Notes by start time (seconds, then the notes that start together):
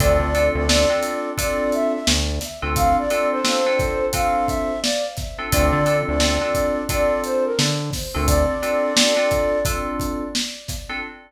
0.00 D2 C4 D4 F4 A4 D5, kick, closed hi-hat
0.20 D2
0.34 C4 D4 F4 A4, closed hi-hat
0.55 D2 D5
0.69 C4 D4 F4 A4, snare
0.90 C4 D4 F4 A4
1.03 closed hi-hat
1.37 C4 D4 F4 A4 D5, kick, closed hi-hat
1.72 E5, closed hi-hat
1.93 E5
2.07 D2, snare
2.41 snare, closed hi-hat
2.62 D2 C4 D4 F4 A4
2.76 F5, kick, closed hi-hat
2.98 D5
3.10 C4 D4 F4 A4, closed hi-hat
3.31 C5
3.44 C4 D4 F4 A4, snare
3.66 C4 D4 F4 A4
3.79 kick, closed hi-hat
4.13 C4 D4 F4 A4 F5, kick, closed hi-hat
4.47 E5, kick, closed hi-hat
4.82 D5, snare
5.17 kick, snare, closed hi-hat
5.38 C4 D4 F4 A4
5.52 D2 C4 D4 F4 A4 D5, kick, closed hi-hat
5.73 D3
5.86 C4 D4 F4 A4, closed hi-hat
6.08 D2 D5
6.20 C4 D4 F4 A4, snare
6.41 C4 D4 F4 A4
6.55 kick, closed hi-hat
6.89 C4 D4 F4 A4 D5, kick, closed hi-hat
7.24 C5, closed hi-hat
7.45 A#4
7.59 D3, snare
7.93 kick, snare, open hi-hat
8.14 D2 C4 D4 F4 A4
8.27 D5, kick, closed hi-hat
8.62 C4 D4 F4 A4, closed hi-hat
8.96 C4 D4 F4 A4, snare
9.17 C4 D4 F4 A4
9.31 kick, closed hi-hat
9.65 C4 D4 F4 A4, kick, closed hi-hat
10.00 kick, closed hi-hat
10.35 snare
10.68 kick, snare, closed hi-hat
10.89 C4 D4 F4 A4